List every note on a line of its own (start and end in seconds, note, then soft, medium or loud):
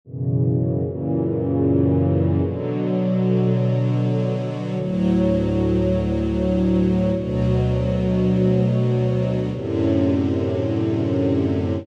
0.05 0.82 F#2 medium
0.05 0.83 B2 medium
0.05 0.82 C#3 medium
0.05 0.82 E3 medium
0.83 2.39 F#2 medium
0.83 2.39 A#2 medium
0.83 2.39 C#3 medium
0.83 2.39 E3 medium
2.40 4.75 B2 medium
2.40 4.75 D3 medium
2.40 4.75 F#3 medium
4.76 7.11 D2 medium
4.76 7.11 A2 medium
4.76 7.11 F#3 medium
7.14 9.49 D2 medium
7.14 9.49 B2 medium
7.14 9.49 F#3 medium
9.51 11.86 F#2 medium
9.51 11.86 A2 medium
9.51 11.86 C3 medium
9.51 11.86 D3 medium